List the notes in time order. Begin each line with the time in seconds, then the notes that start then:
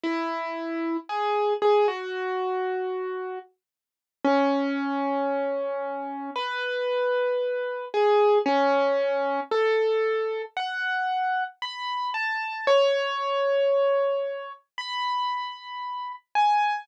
0.04 E4
1.09 G#4
1.62 G#4
1.88 F#4
4.25 C#4
6.36 B4
7.94 G#4
8.46 C#4
9.52 A4
10.57 F#5
11.62 B5
12.14 A5
12.67 C#5
14.78 B5
16.35 G#5